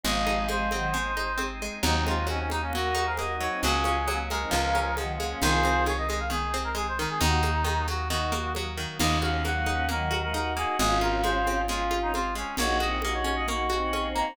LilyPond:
<<
  \new Staff \with { instrumentName = "Clarinet" } { \time 4/4 \key ees \dorian \tempo 4 = 134 ees''4 c''2~ c''8 r8 | ees'8 f'8 des'16 des'16 ees'16 des'16 ges'8 ges'16 bes'16 ees''8 des''8 | aes'4. bes'4. r4 | c''4 des''16 ees''16 ees''16 f''16 aes'8. bes'16 aes'16 c''16 bes'16 aes'16 |
ees'4. ges'8 ges'4 r4 | ees''8 f''8 ges''4 bes'8. bes'16 bes'8 aes'8 | aes'8 bes'8 c''4 f'8. ees'16 f'8 des'8 | des''8 ees''8 ees''16 des''16 des''16 ees''16 des'''4. bes''8 | }
  \new Staff \with { instrumentName = "Choir Aahs" } { \time 4/4 \key ees \dorian <f aes>4 <f aes>8 <ees ges>8 r2 | <c' ees'>16 <aes c'>8 r16 <c' ees'>16 <c' ees'>16 r16 <bes des'>16 <ges' bes'>8. <aes' c''>16 \tuplet 3/2 { <ges' bes'>8 <ees' ges'>8 <c' ees'>8 } | <bes des'>16 <des' f'>8 r16 <bes des'>16 <bes des'>16 r16 <c' ees'>16 <des f>8. <des f>16 \tuplet 3/2 { <ees ges>8 <ges bes>8 <bes des'>8 } | <f' aes'>4 r2. |
<ees' ges'>8 r4. <ees' ges'>8 r4. | r8 <bes des'>8 <ges bes>8 <bes des'>8 <ees ges>8 <ees ges>16 <f aes>16 <ees' ges'>8 <ees' ges'>8 | <des' f'>2 <des' f'>4 r4 | <ees' ges'>8 <c' ees'>8 <ees' ges'>4 <ees' ges'>8 <c' ees'>4. | }
  \new Staff \with { instrumentName = "Pizzicato Strings" } { \time 4/4 \key ees \dorian aes8 ees'8 aes8 c'8 aes8 ees'8 c'8 aes8 | ges8 ees'8 ges8 bes8 ges8 ees'8 bes8 ges8 | ges8 des'8 ges8 aes8 f8 des'8 f8 aes8 | ees8 c'8 ees8 aes8 ees8 c'8 aes8 ees8 |
ees8 bes8 ees8 ges8 ees8 bes8 ges8 ees8 | bes8 ges'8 bes8 ees'8 bes8 ges'8 ees'8 bes8 | aes8 f'8 aes8 c'8 aes8 f'8 c'8 aes8 | bes8 ges'8 bes8 des'8 bes8 ges'8 des'8 bes8 | }
  \new Staff \with { instrumentName = "Electric Bass (finger)" } { \clef bass \time 4/4 \key ees \dorian aes,,1 | ees,1 | des,2 des,2 | c,1 |
ees,1 | ees,1 | aes,,1 | bes,,1 | }
  \new Staff \with { instrumentName = "Drawbar Organ" } { \time 4/4 \key ees \dorian <aes c' ees'>1 | <ges bes ees'>1 | <ges aes des'>2 <f aes des'>2 | <ees aes c'>1 |
<ees ges bes>1 | <bes ees' ges'>1 | <aes c' f'>1 | <bes des' ges'>1 | }
  \new DrumStaff \with { instrumentName = "Drums" } \drummode { \time 4/4 cgl8 cgho8 cgho8 cgho8 cgl8 cgho8 cgho4 | cgl8 cgho8 cgho8 cgho8 cgl8 cgho8 cgho4 | cgl8 cgho8 cgho8 cgho8 cgl8 cgho8 cgho4 | cgl8 cgho8 cgho8 cgho8 cgl8 cgho8 cgho4 |
cgl8 cgho8 cgho8 cgho8 cgl8 cgho8 cgho4 | <cgl cymc>8 cgho8 cgho8 cgho8 cgl8 cgho8 cgho4 | cgl8 cgho8 cgho8 cgho8 cgl8 cgho8 cgho4 | cgl8 cgho8 cgho8 cgho8 cgl8 cgho8 cgho4 | }
>>